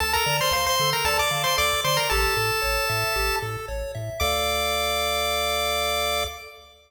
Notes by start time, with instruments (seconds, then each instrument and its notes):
0.00 synth bass 1 D2, lead 1 (square) A4 A5
0.13 lead 1 (square) A#4 A#5
0.26 synth bass 1 D3, lead 1 (square) D5
0.41 lead 1 (square) C5 C6
0.51 synth bass 1 D2, lead 1 (square) C5 F5 C6
0.66 lead 1 (square) C5 C6
0.80 synth bass 1 D3, lead 1 (square) A4
0.93 lead 1 (square) A#4 A#5
1.05 synth bass 1 D2, lead 1 (square) A4 D5 A5
1.19 lead 1 (square) D5 D6
1.31 synth bass 1 D3, lead 1 (square) F5
1.44 lead 1 (square) C5 C6
1.57 synth bass 1 D2, lead 1 (square) A4 D5 D6
1.84 synth bass 1 D3, lead 1 (square) C5 D5 C6
1.97 lead 1 (square) A#4 A#5
2.10 synth bass 1 A1, lead 1 (square) G4 A4 A5
2.37 synth bass 1 A2, lead 1 (square) A4
2.62 synth bass 1 A1, lead 1 (square) C#5
2.89 synth bass 1 A2, lead 1 (square) E5
3.16 synth bass 1 A1, lead 1 (square) G4
3.42 synth bass 1 A2, lead 1 (square) A4
3.68 synth bass 1 A1, lead 1 (square) C#5
3.95 synth bass 1 A2, lead 1 (square) E5
4.20 synth bass 1 D2, lead 1 (square) A4 D5 F5 D6